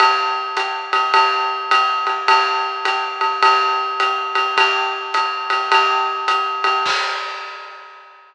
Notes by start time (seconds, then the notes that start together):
0.00 ride
0.57 hi-hat pedal, ride
0.93 ride
1.14 ride
1.71 hi-hat pedal, ride
2.07 ride
2.28 kick, ride
2.85 hi-hat pedal, ride
3.21 ride
3.43 ride
4.00 hi-hat pedal, ride
4.35 ride
4.57 kick, ride
5.14 hi-hat pedal, ride
5.50 ride
5.72 ride
6.28 hi-hat pedal, ride
6.64 ride
6.86 kick, crash